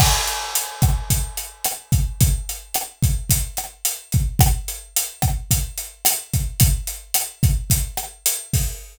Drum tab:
CC |x-------|--------|--------|--------|
HH |-xxxxxxx|xxxxxxxx|xxxxxxxx|xxxxxxxo|
SD |r--r--r-|--r--r--|r--r--r-|--r--r--|
BD |o--oo--o|o--oo--o|o--oo--o|o--oo--o|